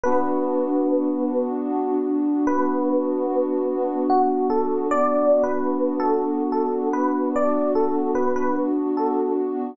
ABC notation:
X:1
M:3/4
L:1/16
Q:1/4=74
K:Bm
V:1 name="Electric Piano 1"
B8 z4 | B8 F2 A2 | (3d4 B4 A4 A2 B2 | d2 A2 B B z2 A2 z2 |]
V:2 name="Pad 2 (warm)"
[B,DF]12 | [B,DF]12 | [B,DF]12 | [B,DF]12 |]